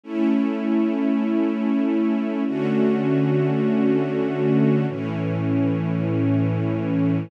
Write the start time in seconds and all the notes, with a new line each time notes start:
0.04 A3 C#4 E4
2.46 D3 A3 C#4 F#4
4.88 A2 E3 C#4